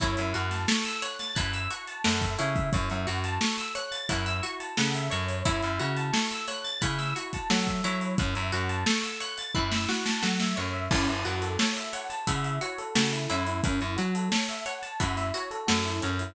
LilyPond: <<
  \new Staff \with { instrumentName = "Pizzicato Strings" } { \time 4/4 \key fis \dorian \tempo 4 = 88 e'8 fis'8 a'8 cis''8 e'8 fis'8 a'8 e'8~ | e'8 fis'8 a'8 cis''8 e'8 fis'8 a'8 cis''8 | e'8 fis'8 a'8 cis''8 e'8 fis'8 a'8 e'8~ | e'8 fis'8 a'8 cis''8 e'8 fis'8 a'8 cis''8 |
e'8 fis'8 a'8 cis''8 e'8 fis'8 a'8 e'8~ | e'8 fis'8 a'8 cis''8 e'8 fis'8 a'8 cis''8 | }
  \new Staff \with { instrumentName = "Electric Piano 1" } { \time 4/4 \key fis \dorian cis''16 e''16 fis''16 a''16 cis'''16 e'''16 fis'''16 a'''16 fis'''16 e'''16 cis'''16 a''16 fis''16 e''16 cis''16 e''16 | cis''16 e''16 fis''16 a''16 cis'''16 e'''16 fis'''16 a'''16 fis'''16 e'''16 cis'''16 a''16 fis''16 e''16 cis''8~ | cis''16 e''16 fis''16 a''16 cis'''16 e'''16 fis'''16 a'''16 fis'''16 e'''16 cis'''16 a''16 fis''16 e''16 cis''8~ | cis''16 e''16 fis''16 a''16 cis'''16 e'''16 fis'''16 a'''16 fis'''16 e'''16 cis'''16 a''16 fis''16 e''16 cis''16 e''16 |
cis'16 e'16 fis'16 a'16 cis''16 e''16 fis''16 a''16 fis''16 e''16 cis''16 a'16 fis'16 e'16 cis'16 e'16 | cis'16 e'16 fis'16 a'16 cis''16 e''16 fis''16 a''16 fis''16 e''16 cis''16 a'16 fis'16 e'16 cis'16 e'16 | }
  \new Staff \with { instrumentName = "Electric Bass (finger)" } { \clef bass \time 4/4 \key fis \dorian fis,16 fis,16 fis,4. fis,4 fis,8 cis8 | fis,16 fis,16 fis,4. fis,4 cis8 fis,8 | fis,16 fis,16 cis4. cis4 fis8 fis8 | fis,16 fis,16 fis,4. fis,4 fis8 fis,8 |
fis,16 fis,16 fis,4. cis4 cis8 fis,8 | fis,16 fis,16 fis4. fis,4 fis,8 fis,8 | }
  \new DrumStaff \with { instrumentName = "Drums" } \drummode { \time 4/4 <hh bd>16 hh16 hh16 <hh sn>16 sn16 hh16 hh16 <hh sn>16 <hh bd>16 hh16 hh16 hh16 sn16 <hh bd>16 hh16 <hh bd>16 | <hh bd>16 hh16 hh16 hh16 sn16 hh16 hh16 hh16 <hh bd>16 hh16 hh16 hh16 sn16 hh16 hh16 hh16 | <hh bd>16 hh16 hh16 hh16 sn16 hh16 <hh sn>16 hh16 <hh bd>16 <hh sn>16 hh16 <hh bd>16 sn16 <hh bd>16 hh16 hh16 | <hh bd>16 hh16 hh16 hh16 sn16 hh16 hh16 hh16 bd16 sn16 sn16 sn16 sn16 sn8. |
<cymc bd>16 hh16 hh16 hh16 sn16 hh16 hh16 hh16 <hh bd>16 hh16 hh16 hh16 sn16 hh16 hh16 hh16 | <hh bd>16 hh16 hh16 hh16 sn16 hh16 hh16 hh16 <hh bd>16 <hh sn>16 hh16 hh16 sn16 hh16 hh16 hh16 | }
>>